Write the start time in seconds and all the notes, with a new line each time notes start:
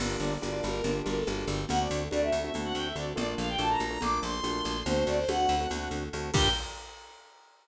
0.00 G1 A#3 D4 F4 G4, crash, low conga, shaker
0.20 G1 D5, shaker
0.42 G1 A#3 D4 F4 G4, high conga, shaker
0.52 A#3 D4 F4 G4
0.63 G1 A#4, high conga, shaker
0.74 A#3 D4 F4 G4
0.84 G1 A#3 D4 F4 G4, low conga, shaker
1.05 G1 A#4, high conga, shaker
1.16 A4
1.27 G1 A#3 D4 F4 G4, high conga, shaker
1.47 G1 G4, high conga, shaker
1.69 D2 A3 C4 D4 F#4 F#5, low conga, shaker
1.80 D5
1.90 D2, shaker
2.11 D2 A3 C4 D4 F#4 D5, high conga, shaker
2.22 A3 C4 D4 F#4 E5
2.32 D2, shaker
2.43 A3 C4 D4 F#4 E5
2.54 D2 A3 C4 D4 F#4, low conga, shaker
2.64 F#5
2.74 D2 G5, shaker
2.85 E5
2.96 D2 A3 C4 D4 F#4 D5, shaker
3.16 A#1 A3 A#3 D4 F4 D5, low conga, shaker
3.38 A#1 F5, shaker
3.49 G5
3.58 A#1 A3 A#3 D4 F4 A5, high conga, shaker
3.70 A3 A#3 D4 F4 A#5
3.79 A#1 A#5, high conga, shaker
3.90 A3 A#3 D4 F4 A#5
4.01 A#1 A3 A#3 D4 F4 D6, low conga, shaker
4.23 A#1 C6, shaker
4.43 A#1 A3 A#3 D4 F4, high conga, shaker
4.64 A#1, high conga, shaker
4.86 D2 A3 C4 D4 F#4 C5, low conga, shaker
5.06 D2 D5, shaker
5.18 C5
5.28 D2 A3 C4 D4 F#4 F#5, high conga, shaker
5.39 A3 C4 D4 F#4
5.48 D2, shaker
5.60 A3 C4 D4 F#4
5.70 D2 A3 C4 D4 F#4, low conga, shaker
5.90 D2, shaker
6.13 D2 A3 C4 D4 F#4, shaker
6.34 G2 A#3 D4 F4 G4 G5, kick, crash